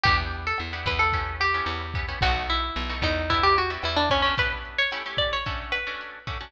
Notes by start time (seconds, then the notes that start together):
0.03 E2 B3 D4 E4 G4, kick, closed hi-hat
0.31 closed hi-hat
0.47 A4
0.58 E2, cross-stick, closed hi-hat
0.73 B3 D4 E4 G4
0.86 E2 B4, kick, closed hi-hat
0.99 A4
1.12 B3 C#4 E4 G4, kick, closed hi-hat
1.40 G4, cross-stick, closed hi-hat
1.54 B3 C#4 E4 G4
1.66 E2, closed hi-hat
1.94 B3 C#4 E4 G4, kick, closed hi-hat
2.08 B3 C#4 E4 G4
2.21 B1 A3 B3 D#4 F#4, kick, cross-stick, closed hi-hat
2.49 E4, closed hi-hat
2.76 B1, closed hi-hat
2.89 A3 B3 D#4 F#4
3.02 E2 D#4, kick, cross-stick, closed hi-hat
3.29 B3 D4 E4 G4, kick, closed hi-hat
3.43 G4
3.56 F#4, closed hi-hat
3.70 B3 D4 E4 G4
3.82 E2 E4, cross-stick, closed hi-hat
3.96 D4
4.10 B3 C#4 D4 E4 G4, kick, closed hi-hat
4.22 B3 C#4 D4 E4 G4
4.37 B3 D4 E4 G4 B4, kick, closed hi-hat
4.65 closed hi-hat
4.78 C#5
4.91 A3 C#4 E4 G4, cross-stick, closed hi-hat
5.05 A3 C#4 E4 G4
5.17 D5, kick, closed hi-hat
5.33 C#5
5.46 A3 C#4 D4 F#4, kick, closed hi-hat
5.72 B4, cross-stick, closed hi-hat
5.86 A3 C#4 D4 F#4
6.01 closed hi-hat
6.27 A3 C#4 D4 F#4, kick, open hi-hat
6.40 A3 C#4 D4 F#4